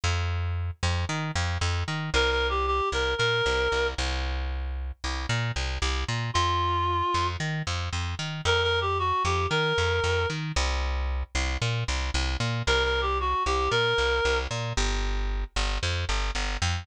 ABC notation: X:1
M:4/4
L:1/8
Q:1/4=114
K:C
V:1 name="Clarinet"
z8 | (3_B B G G B B3 z | z8 | F4 z4 |
(3_B B G ^F G B3 z | z8 | (3_B B G ^F G B3 z | z8 |]
V:2 name="Electric Bass (finger)" clef=bass
F,,3 F,, _E, F,, F,, E, | C,,3 C,, _B,, C,, C,, C,,- | C,,3 C,, _B,, C,, C,, B,, | F,,3 F,, _E, F,, F,, E, |
F,,3 F,, _E, F,, F,, E, | C,,3 C,, _B,, C,, C,, B,, | C,,3 C,, _B,, C,, C,, B,, | G,,,3 G,,, F,, G,,, G,,, F,, |]